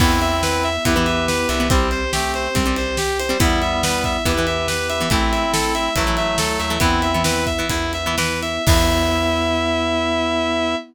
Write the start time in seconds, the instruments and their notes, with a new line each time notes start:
0.00 electric bass (finger) E2, acoustic guitar (steel) E3 B3, drawbar organ B3 E4, pad 5 (bowed) B3 E4, clarinet C4 E4, distortion guitar E4, kick, crash
0.21 distortion guitar E5, ride
0.43 distortion guitar B4, snare
0.63 distortion guitar E5, ride
0.85 electric bass (finger) E2, acoustic guitar (steel) E3 B3, drawbar organ B3 E4, distortion guitar E4, clarinet G4 B4, kick, ride
0.96 acoustic guitar (steel) E3 B3
1.06 distortion guitar E5, ride
1.28 distortion guitar B4, snare
1.49 electric bass (finger) C2, distortion guitar E5, ride
1.60 acoustic guitar (steel) E3 B3
1.70 acoustic guitar (steel) G3 C4, distortion guitar C4, drawbar organ C4 G4, pad 5 (bowed) C4 G4, clarinet E4 G4, kick, ride
1.91 distortion guitar C5, ride
2.12 clarinet A3 C4, distortion guitar G4, snare
2.34 distortion guitar C5, ride
2.55 electric bass (finger) C2, acoustic guitar (steel) G3 C4, distortion guitar C4, drawbar organ C4 G4, kick, ride
2.66 acoustic guitar (steel) G3 C4
2.76 distortion guitar C5, ride
2.97 distortion guitar G4, snare
3.19 distortion guitar C5, ride
3.29 acoustic guitar (steel) G3 C4
3.40 electric bass (finger) E2, acoustic guitar (steel) E3 B3, clarinet G3 B3, drawbar organ B3 E4, pad 5 (bowed) B3 E4, distortion guitar E4, kick, ride
3.62 distortion guitar E5, ride
3.83 distortion guitar B4, snare
4.04 distortion guitar E5, kick, ride
4.25 electric bass (finger) E2, acoustic guitar (steel) E3 B3, drawbar organ B3 E4, distortion guitar E4, clarinet G4 B4, kick, ride
4.38 acoustic guitar (steel) E3 B3
4.47 distortion guitar E5, ride
4.68 distortion guitar B4, snare
4.89 distortion guitar E5, ride
5.00 acoustic guitar (steel) E3 B3
5.10 electric bass (finger) A1, acoustic guitar (steel) E3 A3, pad 5 (bowed) A3 E4, clarinet C4 E4, distortion guitar E4, kick, ride
5.32 distortion guitar E5, ride
5.53 distortion guitar A4, snare
5.75 distortion guitar E5, ride
5.96 electric bass (finger) A1, acoustic guitar (steel) E3 A3, clarinet F#3 A3, distortion guitar E4, kick, ride
6.07 acoustic guitar (steel) E3 A3
6.17 distortion guitar E5, ride
6.38 electric bass (finger) D2, distortion guitar A4, snare
6.59 electric bass (finger) D#2, distortion guitar E5, ride
6.70 acoustic guitar (steel) E3 A3
6.80 electric bass (finger) E2, acoustic guitar (steel) E3 B3, drawbar organ B3 E4, pad 5 (bowed) B3 E4, clarinet C4 E4, distortion guitar E4, kick, ride
7.02 distortion guitar E5, ride
7.13 acoustic guitar (steel) E3 B3, clarinet C4 E4
7.24 acoustic guitar (steel) E3 B3, drawbar organ B3 E4, distortion guitar B4, snare
7.46 distortion guitar E5, kick, ride
7.59 acoustic guitar (steel) E3 B3
7.69 electric bass (finger) E2, drawbar organ B3 E4, distortion guitar E4, kick, ride
7.93 distortion guitar E5, ride
8.06 acoustic guitar (steel) E3 B3
8.17 acoustic guitar (steel) E3 B3, drawbar organ B3 E4, distortion guitar B4, snare
8.42 distortion guitar E5, ride
8.67 electric bass (finger) E2, acoustic guitar (steel) E3 B3, pad 5 (bowed) B3 E4, drawbar organ B3 E4, clarinet E4, distortion guitar E5, kick, crash